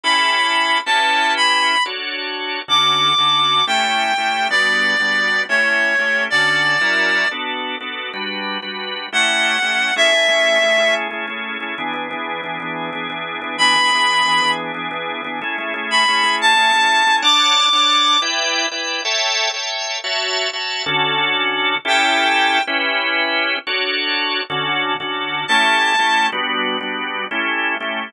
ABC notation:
X:1
M:5/8
L:1/8
Q:1/4=182
K:D
V:1 name="Clarinet"
b5 | [M:6/8] a3 b3 | [M:5/8] z5 | [M:6/8] d'6 |
[M:5/8] g5 | [M:6/8] d6 | [M:5/8] c5 | [M:6/8] d6 |
[M:5/8] z5 | [M:6/8] z6 | [M:5/8] f5 | [M:6/8] [K:A] e6 |
[M:5/8] z5 | [M:6/8] z6 | [M:5/8] z5 | [M:6/8] b6 |
[M:5/8] z5 | [M:6/8] z3 b3 | [M:5/8] a5 | [M:6/8] [K:D] d'6 |
[M:5/8] z5 | [M:6/8] z6 | [M:5/8] z5 | [M:6/8] z6 |
[M:5/8] g5 | [M:6/8] z6 | [M:5/8] z5 | [M:6/8] z6 |
[M:5/8] a5 | [M:6/8] z6 | [M:5/8] z5 |]
V:2 name="Drawbar Organ"
[CEGA]5 | [M:6/8] [CEGB]6 | [M:5/8] [DFAc]5 | [M:6/8] [D,CFA]3 [D,CFA]3 |
[M:5/8] [A,CEG]3 [A,CEG]2 | [M:6/8] [G,B,DF]3 [G,B,DF]3 | [M:5/8] [A,CEG]3 [A,CEG]2 | [M:6/8] [D,CFA]3 [F,CE^A]3 |
[M:5/8] [B,DFA]3 [B,DFA]2 | [M:6/8] [G,DFB]3 [G,DFB]3 | [M:5/8] [A,CEG]3 [A,CEG]2 | [M:6/8] [K:A] [A,CEG] [A,CEG] [A,CEG]2 [A,CEG] [A,CEG]- |
[M:5/8] [A,CEG] [A,CEG] [A,CEG]2 [A,CEG] | [M:6/8] [E,B,DG] [E,B,DG] [E,B,DG]2 [E,B,DG] [E,B,DG]- | [M:5/8] [E,B,DG] [E,B,DG] [E,B,DG]2 [E,B,DG] | [M:6/8] [E,B,DG] [E,B,DG] [E,B,DG]2 [E,B,DG] [E,B,DG]- |
[M:5/8] [E,B,DG] [E,B,DG] [E,B,DG]2 [E,B,DG] | [M:6/8] [A,CEG] [A,CEG] [A,CEG]2 [A,CEG] [A,CEG]- | [M:5/8] [A,CEG] [A,CEG] [A,CEG]2 [A,CEG] | [M:6/8] [K:D] [Dcfa]3 [Dcfa]3 |
[M:5/8] [EBdg]3 [EBdg]2 | [M:6/8] [Aceg]3 [Aceg]3 | [M:5/8] [Fcea]3 [Fcea]2 | [M:6/8] [D,CFA]6 |
[M:5/8] [CEGA]5 | [M:6/8] [CEGB]6 | [M:5/8] [DFAc]5 | [M:6/8] [D,CFA]3 [D,CFA]3 |
[M:5/8] [A,CEG]3 [A,CEG]2 | [M:6/8] [G,B,DF]3 [G,B,DF]3 | [M:5/8] [A,CEG]3 [A,CEG]2 |]